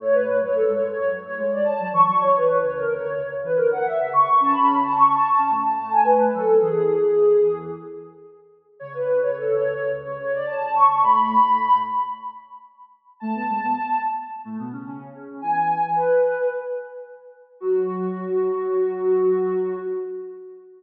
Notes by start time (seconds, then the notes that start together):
0.00 A2 A3 C#5
0.13 B4
0.27 A2 A3
0.40 F#2 F#3 C#5
0.55 A4
0.68 G#2 G#3
0.74 C#5
0.82 G#2 G#3
0.91 C#5
0.96 F#2 F#3
1.11 F#2 F#3
1.23 A2 A3 C#5
1.37 G#2 G#3 C#5
1.51 D5
1.64 A5
1.80 F#2 F#3
1.92 E2 E3 C#6
2.07 F#2 F#3
2.21 E2 E3 C#5
2.36 B4
2.49 E2 E3
2.61 C#2 C#3 C#5
2.76 A#4
2.88 D2 D3
2.94 C#5
3.03 D2 D3
3.12 C#2 C#3 C#5
3.31 C#2 C#3
3.43 E2 E3 B4
3.56 D2 D3 A#4
3.71 F#5
3.86 E5
3.99 C#2 C#3
4.13 C#2 C#3 C#6
4.28 C#2 C#3
4.40 C#3 C#4 A5
4.53 B5
4.83 A5
4.95 C#6
5.13 A5
5.31 A5
5.37 C#3 C#4
5.50 A2 A3
5.65 A5
5.77 A2 A3 A5
5.92 G#5
6.04 B4
6.33 F#2 F#3 A4
6.60 E2 E3 G#4
8.79 C#2 C#3 C#5
8.94 B4
9.07 C#2 C#3
9.23 C#2 C#3 C#5
9.37 A4
9.50 C#2 C#3
9.55 C#5
9.63 C#2 C#3
9.73 C#5
9.77 C#2 C#3
9.90 C#2 C#3
10.05 C#2 C#3 C#5
10.18 C#2 C#3 C#5
10.33 D5
10.47 A5
10.59 C#2 C#3
10.74 C#2 C#3 C#6
10.86 C#2 C#3
11.00 A2 A3 B5
11.43 A2 A3
13.20 A2 A3 A5
13.34 B2 B3
13.49 G#2 G#3
13.63 B2 B3
14.45 A2 A3
14.59 B2 B3
14.72 C#3 C#4
14.86 C#3 C#4
15.14 C#3 C#4
15.41 E2 E3 G#5
15.95 B4
17.60 F#3 F#4